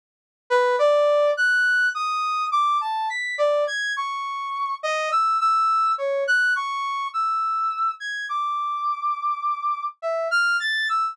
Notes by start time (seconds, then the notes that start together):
0.50 B4
0.79 D5
1.37 F#6
1.94 D#6
2.52 D6
2.81 A5
3.10 B6
3.38 D5
3.67 G#6
3.96 C#6
4.83 D#5
5.12 E6
5.40 E6
5.98 C#5
6.27 F#6
6.56 C#6
7.13 E6
8.00 G#6
8.29 D6
10.02 E5
10.31 F6
10.60 A6
10.89 E6